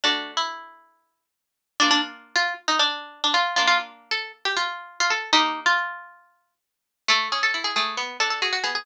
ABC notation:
X:1
M:4/4
L:1/16
Q:1/4=136
K:A
V:1 name="Harpsichord"
D3 E9 z4 | [K:Bb] D D z3 F2 z E D4 D F2 | F F z3 A2 z G F4 F A2 | E3 F9 z4 |
[K:A] A2 G A2 G G2 z2 A A G F G G |]
V:2 name="Harpsichord"
[A,DF]16 | [K:Bb] [B,DF]16 | [B,D]16 | [B,EG]16 |
[K:A] A,2 C2 E2 A,2 B,2 D2 F2 B,2 |]